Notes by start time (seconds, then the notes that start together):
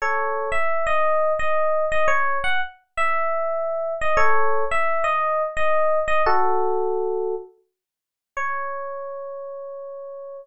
0.02 A4 C#5
0.52 E5
0.87 D#5
1.39 D#5
1.92 D#5
2.08 C#5
2.44 F#5
2.97 E5
4.01 D#5
4.17 A4 C#5
4.71 E5
5.04 D#5
5.57 D#5
6.08 D#5
6.26 F#4 A4
8.37 C#5